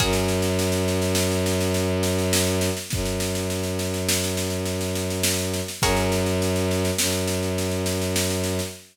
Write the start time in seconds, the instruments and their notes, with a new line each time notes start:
0.00 violin F#2, pizzicato strings F#4 G#4 A#4 C#5, kick, snare
0.13 snare
0.28 snare
0.42 snare
0.59 snare
0.72 snare
0.88 snare
1.02 snare
1.15 snare
1.32 snare
1.46 snare
1.61 snare
1.74 snare
2.03 snare
2.19 snare
2.33 snare
2.47 snare
2.61 snare
2.77 snare
2.90 violin F#2, kick, snare
3.05 snare
3.20 snare
3.35 snare
3.50 snare
3.63 snare
3.79 snare
3.94 snare
4.09 snare
4.24 snare
4.37 snare
4.50 snare
4.65 snare
4.81 snare
4.95 snare
5.10 snare
5.23 snare
5.38 snare
5.54 snare
5.68 snare
5.82 violin F#2, pizzicato strings F#4 G#4 A#4 C#5, kick, snare
5.96 snare
6.12 snare
6.26 snare
6.42 snare
6.56 snare
6.71 snare
6.85 snare
6.98 violin F#2, snare
7.12 snare
7.27 snare
7.43 snare
7.58 snare
7.71 snare
7.86 snare
8.02 snare
8.16 snare
8.30 snare
8.44 snare
8.59 snare